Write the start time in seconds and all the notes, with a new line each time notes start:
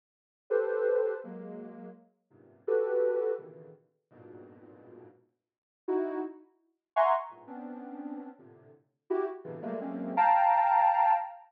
0.50 G4 A4 B4 C5
1.24 F#3 G#3 A#3
2.30 F#2 G2 G#2 A#2 C3
2.67 F#4 G4 A4 B4
3.38 A#2 B2 C#3 D3 D#3 E3
4.11 F2 G2 G#2 A#2 B2
5.88 D#4 E4 F#4
6.96 E5 F#5 G#5 A#5 C6 C#6
7.30 G2 G#2 A2 A#2
7.47 B3 C4 C#4 D4
8.39 A2 A#2 C3 D3
9.10 E4 F#4 G4
9.44 A2 B2 C3 C#3 D3 E3
9.62 F#3 G3 G#3 A3 A#3
9.81 F#3 G#3 A3 A#3 C4 C#4
10.17 F5 G5 A5 A#5